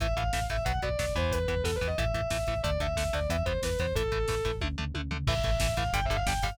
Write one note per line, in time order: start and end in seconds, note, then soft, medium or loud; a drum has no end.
0.00 0.14 A1 medium
0.00 0.07 E3 loud
0.00 0.07 A3 loud
0.00 0.14 E5 loud
0.00 kick medium
0.00 closed hi-hat medium
0.08 kick medium
0.16 0.31 A1 medium
0.16 0.23 E3 medium
0.16 0.23 A3 medium
0.16 0.43 F5 medium
0.16 kick medium
0.16 closed hi-hat medium
0.24 kick medium
0.33 0.47 A1 medium
0.33 0.40 E3 medium
0.33 0.40 A3 medium
0.33 kick medium
0.33 snare loud
0.42 kick medium
0.49 0.64 A1 medium
0.49 0.57 E3 medium
0.49 0.57 A3 medium
0.49 0.64 E5 medium
0.49 kick medium
0.49 closed hi-hat medium
0.58 kick medium
0.65 0.80 B1 medium
0.65 0.72 F#3 medium
0.65 0.72 B3 loud
0.65 0.79 F#5 medium
0.65 kick medium
0.65 closed hi-hat medium
0.74 kick medium
0.82 0.96 B1 medium
0.82 0.89 F#3 medium
0.82 0.89 B3 medium
0.82 0.98 D5 medium
0.82 kick medium
0.82 closed hi-hat medium
0.89 kick medium
0.99 1.13 B1 medium
0.99 1.06 F#3 medium
0.99 1.06 B3 medium
0.99 1.13 D5 medium
0.99 kick medium
0.99 snare loud
1.08 kick medium
1.15 1.46 E2 medium
1.15 1.39 E3 loud
1.15 1.39 B3 medium
1.15 1.33 C5 medium
1.15 kick medium
1.15 closed hi-hat medium
1.22 kick medium
1.32 1.48 B4 medium
1.32 kick medium
1.32 closed hi-hat medium
1.40 kick medium
1.48 1.62 E2 medium
1.48 1.55 E3 medium
1.48 1.55 B3 medium
1.48 1.62 B4 medium
1.48 kick medium
1.48 closed hi-hat medium
1.57 kick medium
1.63 1.78 E2 medium
1.63 1.71 E3 medium
1.63 1.71 B3 medium
1.63 1.74 A4 medium
1.63 kick medium
1.63 snare medium
1.73 1.86 B4 medium
1.73 kick medium
1.81 1.95 E2 medium
1.81 1.88 E3 medium
1.81 1.88 B3 medium
1.81 kick medium
1.81 closed hi-hat medium
1.87 1.98 D#5 medium
1.87 kick medium
1.98 2.13 A1 medium
1.98 2.05 E3 medium
1.98 2.05 A3 medium
1.98 2.59 E5 medium
1.98 kick medium
1.98 closed hi-hat medium
2.05 kick medium
2.14 2.28 A1 medium
2.14 2.21 E3 medium
2.14 2.21 A3 medium
2.14 kick medium
2.14 closed hi-hat medium
2.21 kick medium
2.30 2.45 A1 medium
2.30 2.37 E3 medium
2.30 2.37 A3 medium
2.30 kick medium
2.30 snare loud
2.39 kick medium
2.47 2.62 A1 medium
2.47 2.54 E3 medium
2.47 2.54 A3 medium
2.47 kick medium
2.47 closed hi-hat medium
2.56 kick medium
2.63 2.78 D2 medium
2.63 2.70 D3 medium
2.63 2.70 A3 loud
2.63 2.79 D5 medium
2.63 kick loud
2.63 closed hi-hat medium
2.71 kick medium
2.80 2.94 D2 medium
2.80 2.87 D3 medium
2.80 2.87 A3 medium
2.80 3.13 E5 medium
2.80 kick medium
2.80 closed hi-hat medium
2.88 kick medium
2.96 3.10 D2 medium
2.96 3.04 D3 medium
2.96 3.04 A3 medium
2.96 kick medium
2.96 snare loud
3.05 kick medium
3.13 3.28 D2 medium
3.13 3.20 D3 medium
3.13 3.20 A3 medium
3.13 3.29 D5 medium
3.13 kick medium
3.13 closed hi-hat medium
3.21 kick medium
3.29 3.43 E2 medium
3.29 3.37 E3 medium
3.29 3.37 B3 medium
3.29 3.44 E5 medium
3.29 kick medium
3.29 closed hi-hat medium
3.38 kick medium
3.45 3.59 E2 medium
3.45 3.53 E3 medium
3.45 3.53 B3 medium
3.45 3.60 C5 medium
3.45 kick medium
3.45 closed hi-hat medium
3.55 kick medium
3.62 3.77 E2 medium
3.62 3.70 E3 medium
3.62 3.70 B3 medium
3.62 3.78 B4 medium
3.62 kick medium
3.62 snare loud
3.70 kick medium
3.79 3.93 E2 medium
3.79 3.86 E3 medium
3.79 3.86 B3 medium
3.79 3.93 C5 medium
3.79 kick medium
3.79 closed hi-hat medium
3.87 kick medium
3.95 4.10 A1 medium
3.95 4.03 E3 medium
3.95 4.03 A3 medium
3.95 4.48 A4 loud
3.95 kick medium
3.95 closed hi-hat medium
4.03 kick medium
4.12 4.26 A1 medium
4.12 4.18 E3 medium
4.12 4.18 A3 medium
4.12 kick medium
4.12 closed hi-hat medium
4.20 kick medium
4.28 4.42 A1 medium
4.28 4.35 E3 medium
4.28 4.35 A3 medium
4.28 kick medium
4.28 snare medium
4.37 kick medium
4.45 4.60 A1 medium
4.45 4.51 E3 medium
4.45 4.51 A3 medium
4.45 kick medium
4.45 closed hi-hat medium
4.54 kick medium
4.61 4.76 D2 medium
4.61 4.68 D3 medium
4.61 4.68 A3 loud
4.61 kick medium
4.61 high tom medium
4.78 4.93 D2 medium
4.78 4.84 D3 medium
4.78 4.84 A3 medium
4.78 floor tom medium
4.94 5.09 D2 medium
4.94 5.01 D3 medium
4.94 5.01 A3 medium
4.94 high tom medium
5.11 5.25 D2 medium
5.11 5.17 D3 medium
5.11 5.17 A3 medium
5.11 floor tom medium
5.27 5.41 A1 medium
5.27 5.34 E3 loud
5.27 5.34 A3 loud
5.27 5.73 E5 loud
5.27 kick loud
5.27 crash loud
5.36 kick medium
5.43 5.58 A1 medium
5.43 5.51 E3 medium
5.43 5.51 A3 loud
5.43 kick medium
5.43 closed hi-hat medium
5.52 kick medium
5.60 5.75 A1 medium
5.60 5.67 E3 loud
5.60 5.67 A3 medium
5.60 kick loud
5.60 snare loud
5.69 kick medium
5.77 5.91 A1 medium
5.77 5.84 E3 loud
5.77 5.84 A3 medium
5.77 5.90 F5 loud
5.77 kick medium
5.77 closed hi-hat medium
5.86 kick medium
5.93 6.07 G1 medium
5.93 6.00 D3 loud
5.93 6.00 G3 loud
5.93 6.04 G5 loud
5.93 kick medium
5.93 closed hi-hat loud
6.02 6.16 E5 loud
6.02 kick medium
6.09 6.24 G1 medium
6.09 6.17 D3 medium
6.09 6.17 G3 medium
6.09 kick medium
6.09 closed hi-hat medium
6.16 6.26 F5 loud
6.16 kick medium
6.26 6.40 G1 medium
6.26 6.33 D3 medium
6.26 6.33 G3 loud
6.26 6.43 G5 medium
6.26 kick medium
6.26 snare loud
6.35 kick medium
6.42 6.57 G1 medium
6.42 6.50 D3 loud
6.42 6.50 G3 loud
6.42 6.56 F5 medium
6.42 kick medium
6.42 open hi-hat medium
6.51 kick medium